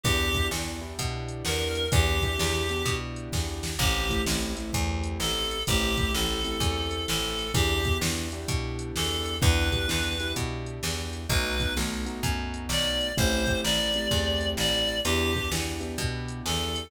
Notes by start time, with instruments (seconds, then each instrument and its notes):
0.04 electric bass (finger) E2, acoustic grand piano B3 D4 E4 G4, clarinet G4, kick, closed hi-hat
0.34 acoustic grand piano B3 D4 E4 G4, kick, closed hi-hat
0.51 electric bass (finger) E2, acoustic grand piano B3 D4 E4 G4, snare
0.81 acoustic grand piano B3 D4 E4 G4
0.99 electric bass (finger) B2, kick, closed hi-hat
1.29 closed hi-hat
1.45 electric bass (finger) E2, clarinet A#4, snare
1.75 closed hi-hat
1.92 electric bass (finger) E2, acoustic grand piano B3 D4 E4 G4, clarinet G4, kick, closed hi-hat
2.22 acoustic grand piano B3 D4 E4 G4, kick, closed hi-hat
2.39 electric bass (finger) E2, acoustic grand piano B3 D4 E4 G4, snare
2.69 acoustic grand piano B3 D4 E4 G4, closed hi-hat
2.86 electric bass (finger) B2, kick, closed hi-hat
3.16 closed hi-hat
3.33 electric bass (finger) E2, kick, snare
3.63 snare
3.79 electric bass (finger) A1, acoustic grand piano A3 C4 E4 G4, clarinet G4, kick, crash
4.10 acoustic grand piano A3 C4 E4 G4, kick, closed hi-hat
4.26 electric bass (finger) A1, acoustic grand piano A3 C4 E4 G4, snare
4.55 acoustic grand piano A3 C4 E4 G4, closed hi-hat
4.73 electric bass (finger) E2, kick, closed hi-hat
5.04 closed hi-hat
5.20 electric bass (finger) A1, clarinet A4, snare
5.51 closed hi-hat
5.67 electric bass (finger) A1, acoustic grand piano A3 C4 E4 G4, clarinet G4, kick, closed hi-hat
5.97 acoustic grand piano A3 C4 E4 G4, kick, closed hi-hat
6.13 electric bass (finger) A1, acoustic grand piano A3 C4 E4 G4, clarinet A4, snare
6.44 acoustic grand piano A3 C4 E4 G4, closed hi-hat
6.60 electric bass (finger) E2, kick, closed hi-hat
6.91 closed hi-hat
7.08 electric bass (finger) A1, clarinet A4, snare
7.39 closed hi-hat
7.54 electric bass (finger) E2, acoustic grand piano B3 D4 E4 G4, clarinet G4, kick, closed hi-hat
7.85 acoustic grand piano B3 D4 E4 G4, kick, closed hi-hat
8.01 electric bass (finger) E2, acoustic grand piano B3 D4 E4 G4, snare
8.32 acoustic grand piano B3 D4 E4 G4, closed hi-hat
8.48 electric bass (finger) B2, kick, closed hi-hat
8.79 closed hi-hat
8.95 electric bass (finger) E2, clarinet A4, snare
9.26 closed hi-hat
9.42 electric bass (finger) E2, acoustic grand piano B3 D4 E4 G4, clarinet B4, kick, closed hi-hat
9.72 acoustic grand piano B3 D4 E4 G4, kick, closed hi-hat
9.88 electric bass (finger) E2, acoustic grand piano B3 D4 E4 G4, snare
10.20 acoustic grand piano B3 D4 E4 G4, closed hi-hat
10.36 electric bass (finger) B2, kick, closed hi-hat
10.66 closed hi-hat
10.83 electric bass (finger) E2, snare
11.13 closed hi-hat
11.29 electric bass (finger) B1, acoustic grand piano A3 B3 D#4 F#4, clarinet B4, kick, closed hi-hat
11.60 acoustic grand piano A3 B3 D#4 F#4, kick, closed hi-hat
11.77 electric bass (finger) B1, acoustic grand piano A3 B3 D#4 F#4, snare
12.06 acoustic grand piano A3 B3 D#4 F#4, closed hi-hat
12.23 electric bass (finger) F#2, kick, closed hi-hat
12.54 closed hi-hat
12.69 electric bass (finger) B1, clarinet D5, snare
13.01 closed hi-hat
13.17 electric bass (finger) A1, acoustic grand piano A3 C4 E4 G4, clarinet C5, kick, closed hi-hat
13.47 acoustic grand piano A3 C4 E4 G4, kick, closed hi-hat
13.64 electric bass (finger) A1, acoustic grand piano A3 C4 E4 G4, clarinet D5, snare
13.94 acoustic grand piano A3 C4 E4 G4, closed hi-hat
14.11 electric bass (finger) E2, kick, closed hi-hat
14.41 closed hi-hat
14.57 electric bass (finger) A1, clarinet D5, snare
14.88 closed hi-hat
15.05 electric bass (finger) E2, acoustic grand piano B3 D4 E4 G4, clarinet G4, closed hi-hat
15.35 acoustic grand piano B3 D4 E4 G4, kick
15.52 electric bass (finger) E2, acoustic grand piano B3 D4 E4 G4, snare
15.80 acoustic grand piano B3 D4 E4 G4, closed hi-hat
15.98 electric bass (finger) B2, kick, closed hi-hat
16.28 closed hi-hat
16.46 electric bass (finger) E2, clarinet A4, snare
16.76 closed hi-hat